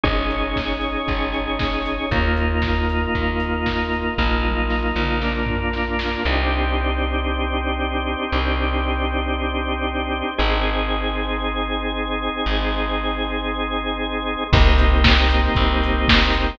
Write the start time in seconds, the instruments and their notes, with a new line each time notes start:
0.04 electric bass (finger) G#1, drawbar organ C#4 D#4 G#4, kick, closed hi-hat
0.31 open hi-hat
0.56 kick, snare
0.81 open hi-hat
1.08 electric bass (finger) G#1, kick, closed hi-hat
1.33 open hi-hat
1.59 kick, snare
1.86 open hi-hat
2.11 electric bass (finger) D#2, drawbar organ A#3 D#4 F4, kick, closed hi-hat
2.37 open hi-hat
2.62 kick, snare
2.89 open hi-hat
3.15 electric bass (finger) D#2, kick, closed hi-hat
3.40 open hi-hat
3.66 kick, snare
3.93 open hi-hat
4.18 electric bass (finger) A#1, drawbar organ A#3 D#4 F4, kick, snare
4.45 high tom
4.70 snare
4.95 electric bass (finger) A#1, mid tom
5.22 drawbar organ A#3 D4 F4, snare
5.46 floor tom
5.73 snare
5.99 snare
6.25 electric bass (finger) C2, drawbar organ C4 D4 D#4 G4
8.32 electric bass (finger) C2
10.38 electric bass (finger) G#1, drawbar organ C4 D#4 G#4
12.46 electric bass (finger) G#1
14.53 electric bass (finger) C2, drawbar organ A#3 C4 D#4 G4, kick, crash
14.78 open hi-hat
15.04 kick, snare
15.30 open hi-hat
15.55 electric bass (finger) C2, kick, closed hi-hat
15.83 open hi-hat
16.08 kick, snare
16.33 open hi-hat